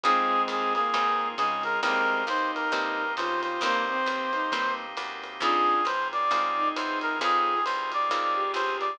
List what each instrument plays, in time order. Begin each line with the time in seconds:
0.04 electric bass (finger) F2, violin G#3 C4, drawbar organ C4 D#4 F4 G#4, acoustic guitar (steel) C4 D#4 F4 G#4, brass section G#4, kick, ride
0.48 electric bass (finger) D#2, brass section G#4, hi-hat pedal, ride
0.75 violin A#3, brass section G#4, ride
0.94 electric bass (finger) G#2, acoustic guitar (steel) C4 D#4 F4 G#4, kick, ride
1.38 electric bass (finger) C#3, violin G#3, brass section G#4, hi-hat pedal, ride
1.63 brass section A#4, ride
1.83 electric bass (finger) C2, violin G#3 C4, acoustic guitar (steel) A#3 C4 D#4 G4, drawbar organ A#3 C4 D#4 G4, brass section A#4, kick, ride
2.27 electric bass (finger) D#2, violin D#4, brass section C5, hi-hat pedal, ride
2.55 brass section A#4, ride
2.72 electric bass (finger) G2, acoustic guitar (steel) A#3 C4 D#4 G4, kick, ride
3.17 electric bass (finger) C#3, violin F4, brass section C5, hi-hat pedal, ride
3.43 brass section C5, ride
3.61 electric bass (finger) C2, violin A#3, drawbar organ A#3 C4 D#4 G4, acoustic guitar (steel) A#3 C4 D#4 G4, brass section C5, kick, ride
3.90 violin C4
4.06 electric bass (finger) D#2, hi-hat pedal, ride
4.33 violin D#4, ride
4.52 electric bass (finger) G2, acoustic guitar (steel) A#3 C4 D#4 G4, kick, ride
4.97 electric bass (finger) F#2, hi-hat pedal, ride
5.24 ride
5.40 electric bass (finger) F2, drawbar organ C4 D#4 F4 G#4, acoustic guitar (steel) C4 D#4 F4 G#4, violin D4 F4, brass section G#4, kick, ride
5.85 electric bass (finger) G#2, brass section C5, hi-hat pedal, ride
6.13 brass section D5, ride
6.31 electric bass (finger) G#2, acoustic guitar (steel) C4 D#4 F4 G#4, kick, ride
6.57 violin D#4
6.76 electric bass (finger) E2, brass section C5, hi-hat pedal, ride
7.01 brass section A#4, ride
7.19 electric bass (finger) F2, drawbar organ C4 D#4 F4 G#4, acoustic guitar (steel) C4 D#4 F4 G#4, violin F4 G#4, brass section G#4, kick, ride
7.65 electric bass (finger) C2, brass section C5, hi-hat pedal, ride
7.92 brass section D5, ride
8.10 electric bass (finger) D#2, acoustic guitar (steel) C4 D#4 F4 G#4, kick, ride
8.34 violin G4
8.54 electric bass (finger) C#2, brass section C5, hi-hat pedal, ride
8.80 brass section D5, ride